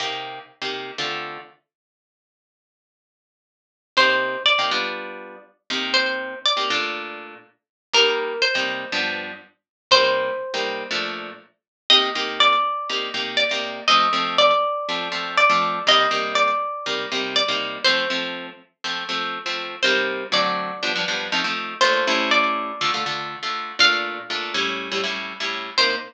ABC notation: X:1
M:4/4
L:1/16
Q:1/4=121
K:Cdor
V:1 name="Acoustic Guitar (steel)"
z16 | z16 | c4 d8 z4 | c4 d8 z4 |
B4 c8 z4 | c10 z6 | e4 d8 d4 | e4 d8 d4 |
e4 d8 d4 | c6 z10 | c4 d8 z4 | c4 d8 z4 |
f8 z8 | c4 z12 |]
V:2 name="Acoustic Guitar (steel)"
[C,B,EG]5 [C,B,EG]3 [D,A,CF]8 | z16 | [C,B,EG]5 [C,B,EG] [G,=B,DF]8 [C,_B,EG]2- | [C,B,EG]5 [C,B,EG] [B,,A,DF]10 |
[C,G,B,E]5 [C,G,B,E]3 [G,,F,=B,D]8 | [C,G,B,E]5 [C,G,B,E]3 [B,,F,A,D]8 | [C,B,EG]2 [C,B,EG]6 [C,B,EG]2 [C,B,EG]3 [C,B,EG]3 | [F,A,C]2 [F,A,C]6 [F,A,C]2 [F,A,C]3 [F,A,C]3 |
[C,G,B,E]2 [C,G,B,E]6 [C,G,B,E]2 [C,G,B,E]3 [C,G,B,E]3 | [F,A,C]2 [F,A,C]6 [F,A,C]2 [F,A,C]3 [F,A,C]3 | [C,G,B,E]4 [D,^F,A,C]4 [G,,=F,=B,D] [G,,F,B,D] [G,,F,B,D]2 [F,A,CE] [F,A,CE]3 | [B,,A,DF]2 [A,,G,^C=E]6 [D,A,F] [D,A,F] [D,A,F]3 [D,A,F]3 |
[B,,A,DF]4 [B,,A,DF]2 [A,,G,^C=E]3 [A,,G,CE] [A,,G,CE]3 [A,,G,CE]3 | [C,B,EG]4 z12 |]